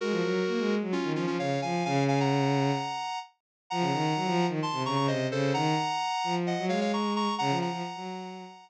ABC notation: X:1
M:4/4
L:1/16
Q:1/4=130
K:Bbm
V:1 name="Lead 1 (square)"
[GB]8 [DF]2 [DF] [DF] [df]2 [fa]2 | [fa]2 [fa] [gb]9 z4 | [gb]8 [=ac']2 [bd'] [bd'] [ce]2 [=Ac]2 | [gb]8 [eg]2 [df] [df] [bd']2 [bd']2 |
[gb]2 [gb]10 z4 |]
V:2 name="Violin"
A, F, G,2 B, A,2 G, z E, F, F, D,2 F,2 | D,8 z8 | F, D, E,2 G, F,2 E, z C, D, D, C,2 D,2 | E,2 z4 F,3 G, A,6 |
D, F,2 F, z G,5 z6 |]